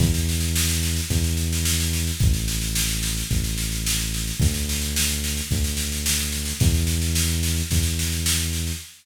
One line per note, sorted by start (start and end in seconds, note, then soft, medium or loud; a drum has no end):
0.00 1.01 E2 loud
0.00 kick loud
0.00 snare medium
0.14 snare medium
0.29 snare medium
0.40 snare medium
0.56 snare loud
0.69 snare medium
0.83 snare medium
0.96 snare medium
1.10 2.11 E2 loud
1.10 kick medium
1.10 snare medium
1.24 snare medium
1.37 snare medium
1.53 snare medium
1.65 snare loud
1.80 snare medium
1.93 snare medium
2.07 snare medium
2.19 3.23 A1 loud
2.19 kick loud
2.19 snare medium
2.34 snare medium
2.48 snare medium
2.61 snare medium
2.75 snare loud
2.89 snare medium
3.03 snare medium
3.17 snare medium
3.31 4.32 A1 loud
3.31 kick medium
3.31 snare medium
3.44 snare medium
3.58 snare medium
3.72 snare medium
3.86 snare loud
4.00 snare medium
4.14 snare medium
4.27 snare medium
4.40 5.41 D2 loud
4.40 kick loud
4.40 snare medium
4.54 snare medium
4.69 snare medium
4.81 snare medium
4.96 snare loud
5.09 snare medium
5.24 snare medium
5.37 snare medium
5.51 6.53 D2 loud
5.51 kick loud
5.51 snare medium
5.64 snare medium
5.77 snare medium
5.92 snare medium
6.06 snare loud
6.19 snare medium
6.32 snare medium
6.45 snare medium
6.60 7.62 E2 loud
6.60 kick loud
6.60 snare medium
6.74 snare medium
6.87 snare medium
7.02 snare medium
7.15 snare loud
7.28 snare medium
7.43 snare medium
7.56 snare medium
7.71 8.72 E2 loud
7.71 kick medium
7.71 snare medium
7.83 snare medium
7.99 snare medium
8.12 snare medium
8.26 snare loud
8.40 snare medium
8.53 snare medium
8.67 snare medium